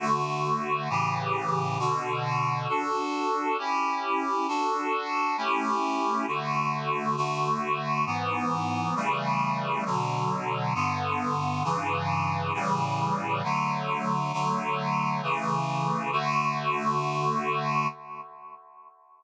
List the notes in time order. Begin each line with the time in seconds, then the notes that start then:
0.00 D3 A3 F#4
0.90 A2 C#3 E3 G4
1.79 B2 D3 F#4
2.68 D4 F#4 A4
3.58 C#4 E4 G4
4.48 D4 F#4 A4
5.37 A3 C#4 E4 G4
6.27 D3 A3 F#4
7.16 D3 A3 F#4
8.06 G#2 E3 B3
8.96 C#3 E3 G3 A3
9.85 B2 D3 F#3
10.75 G2 D3 B3
11.64 G2 C#3 E3
12.54 A2 C#3 E3 G3
13.43 D3 F#3 A3
14.33 D3 F#3 A3
15.22 C#3 E3 A3
16.12 D3 A3 F#4